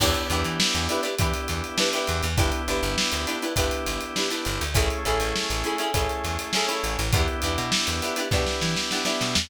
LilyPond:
<<
  \new Staff \with { instrumentName = "Acoustic Guitar (steel)" } { \time 4/4 \key e \dorian \tempo 4 = 101 <d' e' g' b'>8 <d' e' g' b'>4 <d' e' g' b'>16 <d' e' g' b'>16 <d' e' g' b'>4 <d' e' g' b'>16 <d' e' g' b'>8. | <d' e' g' b'>8 <d' e' g' b'>4 <d' e' g' b'>16 <d' e' g' b'>16 <d' e' g' b'>4 <d' e' g' b'>16 <d' e' g' b'>8. | <cis' e' gis' a'>8 <cis' e' gis' a'>4 <cis' e' gis' a'>16 <cis' e' gis' a'>16 <cis' e' gis' a'>4 <cis' e' gis' a'>16 <cis' e' gis' a'>8. | <b d' e' g'>8 <b d' e' g'>4 <b d' e' g'>16 <b d' e' g'>16 <b d' e' g'>4 <b d' e' g'>16 <b d' e' g'>8. | }
  \new Staff \with { instrumentName = "Drawbar Organ" } { \time 4/4 \key e \dorian <b d' e' g'>2 <b d' e' g'>2 | <b d' e' g'>2 <b d' e' g'>2 | <a cis' e' gis'>2 <a cis' e' gis'>2 | <b d' e' g'>2 <b d' e' g'>2 | }
  \new Staff \with { instrumentName = "Electric Bass (finger)" } { \clef bass \time 4/4 \key e \dorian e,8 e,16 e8 e,8. e8 e,4 e,16 e,16 | g,,8 g,,16 g,,8 d,8. g,,8 g,,4 g,,16 d,16 | a,,8 a,,16 a,,8 a,,8. a,,8 e,4 a,,16 a,,16 | e,8 e,16 b,8 e,8. b,8 e4 b,16 e,16 | }
  \new DrumStaff \with { instrumentName = "Drums" } \drummode { \time 4/4 <cymc bd>16 hh16 hh16 hh16 sn16 hh16 hh16 hh16 <hh bd>16 hh16 hh16 hh16 sn16 hh16 <hh sn>16 hh16 | <hh bd>16 hh16 hh16 hh16 sn16 hh16 hh16 hh16 <hh bd>16 hh16 <hh sn>16 hh16 sn16 hh16 <hh sn>16 hh16 | <hh bd>16 hh16 hh16 hh16 sn16 <hh sn>16 hh16 hh16 <hh bd>16 hh16 <hh sn>16 hh16 sn16 hh16 hh16 hh16 | <hh bd>16 hh16 hh16 hh16 sn16 hh16 <hh sn>16 hh16 <bd sn>16 sn16 sn16 sn16 sn16 sn16 sn16 sn16 | }
>>